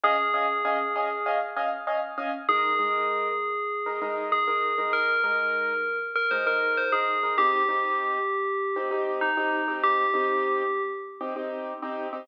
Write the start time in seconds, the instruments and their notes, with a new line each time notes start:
0.04 acoustic grand piano C#4 D#5 F5 G#5, tubular bells G#4
0.34 acoustic grand piano C#4 D#5 F5 G#5
0.65 acoustic grand piano C#4 D#5 F5 G#5
0.96 acoustic grand piano C#4 D#5 F5 G#5
1.26 acoustic grand piano C#4 D#5 F5 G#5
1.57 acoustic grand piano C#4 D#5 F5 G#5
1.87 acoustic grand piano C#4 D#5 F5 G#5
2.18 acoustic grand piano C#4 D#5 F5 G#5
2.49 acoustic grand piano G#3 D#4 A#4, tubular bells G#4
2.79 acoustic grand piano G#3 D#4 A#4
3.86 acoustic grand piano G#3 D#4 A#4
4.02 acoustic grand piano G#3 D#4 A#4
4.32 tubular bells G#4
4.47 acoustic grand piano G#3 D#4 A#4
4.78 acoustic grand piano G#3 D#4 A#4
4.93 tubular bells A#4
5.24 acoustic grand piano G#3 D#4 A#4
6.16 tubular bells A#4
6.31 acoustic grand piano G#3 D#4 A#4, tubular bells C5
6.46 acoustic grand piano G#3 D#4 A#4, tubular bells A#4
6.77 tubular bells C5
6.92 acoustic grand piano G#3 D#4 A#4, tubular bells G#4
7.23 acoustic grand piano G#3 D#4 A#4
7.38 acoustic grand piano C4 D#4 G4, tubular bells G4
7.69 acoustic grand piano C4 D#4 G4
8.76 acoustic grand piano C4 D#4 G4
8.91 acoustic grand piano C4 D#4 G4
9.21 tubular bells D#4
9.37 acoustic grand piano C4 D#4 G4
9.68 acoustic grand piano C4 D#4 G4
9.84 tubular bells G4
10.14 acoustic grand piano C4 D#4 G4
11.21 acoustic grand piano C4 D#4 G4
11.36 acoustic grand piano C4 D#4 G4
11.82 acoustic grand piano C4 D#4 G4
12.13 acoustic grand piano C4 D#4 G4